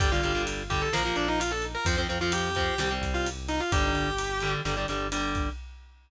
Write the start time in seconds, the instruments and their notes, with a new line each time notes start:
0.00 synth bass 1 G1, overdriven guitar D3 G3, distortion guitar G4, kick, ride
0.12 overdriven guitar D3 G3, distortion guitar F4
0.23 synth bass 1 G1, overdriven guitar D3 G3, ride
0.35 overdriven guitar D3 G3
0.47 ride
0.70 overdriven guitar D3 G3, distortion guitar G4, kick, ride
0.82 distortion guitar A4
0.92 synth bass 1 A#1, overdriven guitar F3 A#3, distortion guitar A#4, snare
1.05 overdriven guitar F3 A#3
1.16 synth bass 1 A#1, distortion guitar D4, snare, ride
1.28 distortion guitar D#4
1.40 distortion guitar F4, ride
1.51 distortion guitar A4
1.62 ride
1.75 distortion guitar A#4
1.85 synth bass 1 F2, overdriven guitar F3 C4, distortion guitar C5, kick, ride
1.98 overdriven guitar F3 C4
2.09 synth bass 1 F2, overdriven guitar F3 C4, ride
2.21 overdriven guitar F3 C4, distortion guitar F4
2.32 distortion guitar G4, ride
2.55 overdriven guitar F3 C4, kick, ride
2.78 synth bass 1 C2, overdriven guitar G3 C4, distortion guitar G4, snare
2.91 overdriven guitar G3 C4
3.01 synth bass 1 C2, kick, snare, ride
3.14 distortion guitar F4
3.26 ride
3.48 distortion guitar D#4, ride
3.60 distortion guitar F4
3.72 synth bass 1 G1, overdriven guitar D3 G3, distortion guitar G4, kick, ride
3.95 synth bass 1 G1, ride
4.18 ride
4.40 overdriven guitar D3 G3, ride
4.65 synth bass 1 G1, overdriven guitar D3 G3, snare
4.77 overdriven guitar D3 G3
4.88 synth bass 1 G1, overdriven guitar D3 G3, snare, ride
5.12 overdriven guitar D3 G3, ride
5.35 kick, ride